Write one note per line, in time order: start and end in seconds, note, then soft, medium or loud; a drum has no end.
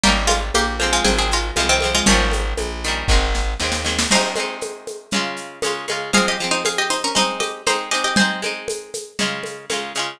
0.03 0.51 G#1 medium
0.03 0.74 G3 loud
0.03 0.16 A#3 medium
0.03 0.74 A#3 loud
0.03 0.74 C#4 medium
0.03 0.16 G4 medium
0.03 low conga medium
0.03 shaker medium
0.09 0.74 D#4 medium
0.27 0.39 G#3 medium
0.27 0.39 F4 medium
0.27 high conga medium
0.27 shaker medium
0.54 1.00 A#1 medium
0.54 0.92 A#3 medium
0.54 0.92 G4 medium
0.54 high conga medium
0.54 shaker medium
0.80 1.52 F3 medium
0.80 1.52 G#3 medium
0.80 1.52 C4 loud
0.80 high conga medium
0.80 shaker medium
0.93 1.05 G#3 medium
0.93 1.05 F4 medium
1.04 1.51 G#1 medium
1.04 1.17 C4 medium
1.04 1.17 G#4 medium
1.04 low conga medium
1.04 shaker medium
1.18 1.31 C4 medium
1.18 1.31 G#4 medium
1.31 1.56 G#3 medium
1.31 1.56 F4 medium
1.31 shaker medium
1.56 2.02 C2 medium
1.56 1.80 F3 medium
1.56 1.69 G#3 medium
1.56 1.80 G#3 medium
1.56 1.69 F4 medium
1.56 high conga medium
1.56 shaker medium
1.60 1.80 C4 medium
1.69 1.93 D#3 medium
1.69 1.93 C4 medium
1.81 2.05 F3 medium
1.81 2.05 G#3 medium
1.81 high conga medium
1.81 shaker medium
1.85 2.05 C4 medium
1.95 2.07 G#3 medium
1.95 2.07 F4 medium
2.06 2.54 G#1 medium
2.06 2.77 D#3 medium
2.06 3.26 F3 medium
2.06 2.77 G3 loud
2.06 3.26 C#4 medium
2.06 low conga loud
2.06 shaker medium
2.10 2.77 A#3 loud
2.10 2.77 C#4 medium
2.31 high conga medium
2.31 shaker medium
2.57 3.03 A#1 medium
2.57 high conga medium
2.57 shaker medium
2.84 3.08 D#3 medium
2.84 3.08 G3 medium
2.84 shaker medium
2.88 3.08 A#3 medium
2.88 3.08 C#4 medium
3.08 3.54 G#1 medium
3.08 3.56 D#3 loud
3.08 3.56 G#3 loud
3.08 kick medium
3.08 snare medium
3.13 3.56 C4 medium
3.35 snare medium
3.60 4.06 D#2 medium
3.60 3.84 D#3 medium
3.60 3.84 G#3 medium
3.60 snare medium
3.64 3.84 C4 medium
3.72 snare medium
3.85 4.08 D#3 medium
3.85 4.08 G#3 medium
3.85 4.08 C4 medium
3.85 snare medium
3.99 snare loud
4.11 4.35 G#3 loud
4.11 4.35 C4 medium
4.11 5.77 D#4 medium
4.11 5.77 C5 loud
4.11 crash loud
4.11 low conga medium
4.11 shaker medium
4.15 4.35 D#4 medium
4.36 5.06 G#3 medium
4.36 5.06 C4 medium
4.36 high conga medium
4.36 shaker medium
4.40 5.06 D#4 medium
4.61 high conga medium
4.61 shaker medium
4.87 high conga medium
4.87 shaker medium
5.11 5.59 C#3 medium
5.11 5.59 G#3 medium
5.11 low conga medium
5.11 shaker medium
5.16 5.59 F4 loud
5.37 shaker medium
5.62 5.86 C#3 medium
5.62 5.86 G#3 medium
5.62 5.86 F4 medium
5.62 high conga medium
5.62 shaker medium
5.88 6.11 C#3 medium
5.88 6.11 G#3 medium
5.88 6.11 F4 medium
5.88 high conga medium
5.88 shaker medium
6.13 6.37 F3 loud
6.13 6.37 G#3 medium
6.13 6.37 C4 medium
6.13 6.26 G#4 medium
6.13 6.26 F5 loud
6.13 low conga medium
6.13 shaker medium
6.28 6.49 G4 medium
6.28 6.49 D#5 medium
6.40 7.10 F3 medium
6.40 7.10 G#3 medium
6.40 shaker medium
6.44 7.10 C4 medium
6.51 6.63 D#4 medium
6.51 6.63 C5 medium
6.65 6.78 G#4 medium
6.65 6.78 F5 medium
6.65 high conga medium
6.65 shaker medium
6.78 6.90 G4 medium
6.78 6.90 D#5 medium
6.90 7.02 D#4 medium
6.90 7.02 C5 medium
6.90 shaker medium
7.04 7.16 C#4 medium
7.04 7.16 A#4 medium
7.15 7.62 G#3 loud
7.15 7.62 C4 medium
7.15 7.38 D#4 medium
7.15 7.62 D#4 loud
7.15 7.38 C5 medium
7.15 low conga medium
7.15 shaker medium
7.40 7.63 G4 medium
7.40 7.63 D#5 medium
7.40 high conga medium
7.40 shaker medium
7.67 7.90 G#3 medium
7.67 7.90 C4 medium
7.67 7.89 D#4 medium
7.67 7.90 D#4 medium
7.67 7.89 C5 medium
7.67 high conga medium
7.67 shaker medium
7.91 8.15 G#3 medium
7.91 8.15 C4 medium
7.91 8.15 D#4 medium
7.91 8.03 G4 medium
7.91 8.03 D#5 medium
7.91 shaker medium
8.04 8.16 G4 medium
8.04 8.16 D#5 medium
8.16 8.41 G#3 medium
8.16 8.41 C4 medium
8.16 10.16 C5 medium
8.16 10.16 G#5 loud
8.16 low conga loud
8.16 shaker medium
8.21 8.41 D#4 medium
8.42 9.13 G#3 medium
8.42 9.13 C4 medium
8.42 9.13 D#4 medium
8.42 high conga medium
8.42 shaker medium
8.68 high conga medium
8.68 shaker medium
8.94 high conga medium
8.94 shaker medium
9.19 9.66 C#3 medium
9.19 9.66 G#3 loud
9.19 9.66 F4 loud
9.19 low conga medium
9.19 shaker medium
9.43 high conga medium
9.43 shaker medium
9.69 9.93 C#3 medium
9.69 9.93 G#3 medium
9.69 9.93 F4 medium
9.69 high conga medium
9.69 shaker medium
9.95 10.19 C#3 medium
9.95 10.19 G#3 medium
9.95 shaker medium
9.99 10.19 F4 medium